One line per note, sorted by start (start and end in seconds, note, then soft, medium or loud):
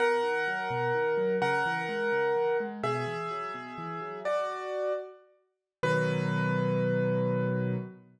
0.00 0.21 B2 medium
0.00 1.36 A#4 medium
0.00 1.36 F#5 medium
0.23 0.44 D#3 medium
0.48 0.69 F#3 medium
0.70 0.92 B2 medium
0.94 1.16 D#3 medium
1.17 1.39 F#3 medium
1.42 1.63 C#3 medium
1.42 2.57 A#4 medium
1.42 2.57 F#5 medium
1.66 1.87 E3 medium
1.89 2.10 G#3 medium
2.12 2.33 C#3 medium
2.36 2.57 E3 medium
2.60 2.81 G#3 medium
2.83 3.05 B2 medium
2.83 4.19 G#4 medium
2.83 4.19 E5 medium
3.07 3.28 E3 medium
3.31 3.52 F#3 medium
3.54 3.76 B2 medium
3.78 3.99 E3 medium
4.01 4.22 F#3 medium
4.25 4.92 F#4 medium
4.25 4.92 D5 medium
5.83 7.76 B2 loud
5.83 7.76 D#3 medium
5.83 7.76 F#3 loud
5.83 7.76 B4 loud